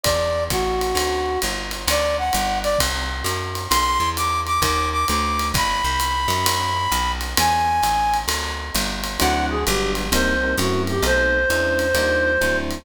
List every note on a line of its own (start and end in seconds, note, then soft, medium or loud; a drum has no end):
0.03 0.49 E2 medium
0.03 0.44 D5 medium
0.03 kick soft
0.03 ride medium
0.50 0.94 A1 medium
0.50 1.40 F#4 medium
0.50 kick soft
0.50 hi-hat pedal medium
0.50 ride medium
0.81 ride medium
0.95 1.38 D2 medium
0.95 ride medium
1.42 1.86 G1 medium
1.42 hi-hat pedal medium
1.42 ride medium
1.71 ride medium
1.87 2.31 D2 medium
1.87 2.17 D5 loud
1.87 ride medium
2.18 2.59 F#5 medium
2.33 2.77 G1 medium
2.33 hi-hat pedal medium
2.33 ride medium
2.63 2.79 D5 loud
2.63 ride medium
2.78 3.23 C2 medium
2.78 kick soft
2.78 ride medium
3.24 3.67 F#2 medium
3.24 hi-hat pedal medium
3.24 ride medium
3.55 ride medium
3.70 3.99 B1 medium
3.70 4.09 C6 loud
3.70 ride medium
4.00 4.60 E2 medium
4.17 4.40 D6 medium
4.17 hi-hat pedal medium
4.17 ride medium
4.46 4.61 D6 medium
4.46 ride soft
4.62 5.05 D#2 loud
4.62 4.89 D6 medium
4.62 kick soft
4.62 ride medium
4.92 5.07 D6 medium
5.08 5.52 D2 medium
5.08 5.48 D6 medium
5.08 hi-hat pedal medium
5.08 ride medium
5.39 ride medium
5.54 5.82 G1 medium
5.54 7.12 B5 loud
5.54 kick medium
5.54 ride medium
5.84 6.27 C2 medium
6.00 hi-hat pedal medium
6.00 ride medium
6.28 6.87 F#2 medium
6.28 ride medium
6.46 ride loud
6.92 7.35 B1 medium
6.92 hi-hat pedal medium
6.92 ride medium
7.21 ride medium
7.37 7.81 E2 medium
7.37 8.17 G#5 loud
7.37 ride loud
7.83 8.26 A1 medium
7.83 hi-hat pedal medium
7.83 ride medium
8.13 ride medium
8.28 8.71 D2 medium
8.28 ride medium
8.74 9.18 G1 medium
8.74 hi-hat pedal medium
8.74 ride medium
9.04 ride medium
9.19 9.65 D2 loud
9.19 9.55 F#3 loud
9.19 9.55 C4 medium
9.19 9.55 D4 medium
9.19 9.55 E4 medium
9.19 9.46 F#5 medium
9.19 ride medium
9.50 9.65 G#4 medium
9.66 10.10 G1 loud
9.66 10.03 F#3 loud
9.66 10.03 G3 medium
9.66 10.03 B3 loud
9.66 10.03 D4 medium
9.66 9.92 G4 medium
9.66 hi-hat pedal medium
9.66 ride medium
9.95 ride medium
10.12 10.55 C2 loud
10.12 10.34 G3 loud
10.12 10.34 A#3 loud
10.12 10.34 C4 loud
10.12 10.34 D#4 loud
10.12 10.55 C5 medium
10.12 ride medium
10.43 10.55 G3 medium
10.43 10.55 A#3 medium
10.43 10.55 C4 medium
10.43 10.55 D#4 medium
10.57 11.01 F#2 loud
10.57 10.95 F#3 medium
10.57 10.95 A3 medium
10.57 10.95 C4 loud
10.57 10.95 E4 medium
10.57 10.82 F#4 medium
10.57 hi-hat pedal medium
10.57 ride medium
10.87 11.03 G4 medium
10.87 ride medium
11.02 11.46 B1 loud
11.02 11.38 A3 loud
11.02 11.38 B3 medium
11.02 11.38 C4 medium
11.02 11.38 D#4 medium
11.02 12.57 C5 medium
11.02 ride medium
11.50 11.93 E2 medium
11.50 11.86 G#3 medium
11.50 11.86 C#4 medium
11.50 11.86 D4 loud
11.50 11.86 E4 loud
11.50 hi-hat pedal medium
11.50 ride medium
11.79 ride medium
11.94 12.38 D#2 loud
11.94 12.32 G3 loud
11.94 12.32 D4 loud
11.94 12.32 D#4 medium
11.94 12.32 F4 loud
11.94 ride medium
12.41 12.84 D2 medium
12.41 12.77 F#3 medium
12.41 12.77 C4 loud
12.41 12.77 D4 loud
12.41 12.77 E4 loud
12.41 hi-hat pedal medium
12.41 ride medium
12.71 ride medium